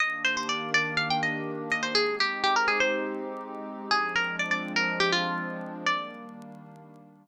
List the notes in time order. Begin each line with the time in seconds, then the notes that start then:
0.00 D#3 A#3 D4 G4 D#5
0.24 C5
0.37 C5
0.49 D5
0.74 D5
0.97 F5
1.10 G5
1.23 D#5
1.71 D#5
1.83 C5
1.95 G#3 C4 D#4 G4 G#4
2.20 G4
2.43 G4
2.56 A#4
2.68 G#4
2.80 C5
3.91 F3 G#3 C4 D4 G#4
4.15 A#4
4.39 D5
4.51 D5
4.76 A#4
5.00 G4
5.12 F4
5.86 D#3 G3 A#3 D4 D5